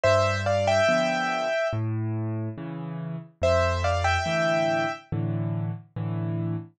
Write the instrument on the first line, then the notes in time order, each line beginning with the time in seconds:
acoustic grand piano
0.04 G2 C5 E5
0.46 D5 F5
0.67 E5 G5
0.88 D3 F3 B3
1.73 A2
2.58 C#3 E3
3.42 F2 C5 E5
3.84 D5 F5
4.04 E5 G5
4.26 A2 D3 E3
5.12 A2 D3 E3
5.96 A2 D3 E3